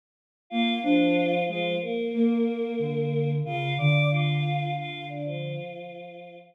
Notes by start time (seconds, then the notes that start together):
0.50 A#3 F4 F5
0.83 F3 D4 F4
1.48 F3 G#3 F4
1.81 A#3 A#4
2.14 A#3
2.79 D3
3.45 C#3 F4 F5
3.78 D3 D5 D6
4.11 F4 F5
4.76 F4 F5
5.09 D4 D5
5.25 F3 F4